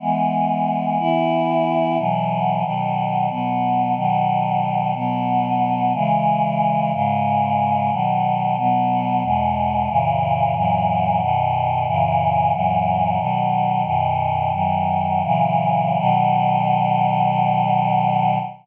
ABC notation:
X:1
M:3/4
L:1/8
Q:1/4=91
K:E
V:1 name="Choir Aahs"
[E,G,B,]3 [E,B,E]3 | [B,,E,F,]2 [B,,D,F,]2 [B,,F,B,]2 | [B,,D,F,]3 [B,,F,B,]3 | [C,E,G,]3 [G,,C,G,]3 |
[K:B] [B,,D,F,]2 [B,,F,B,]2 [E,,B,,G,]2 | [F,,A,,C,E,]2 [F,,A,,E,F,]2 [F,,B,,D,]2 | [F,,A,,C,E,]2 [F,,A,,E,F,]2 [B,,D,F,]2 | "^rit." [F,,B,,D,]2 [F,,D,F,]2 [A,,C,E,F,]2 |
[B,,D,F,]6 |]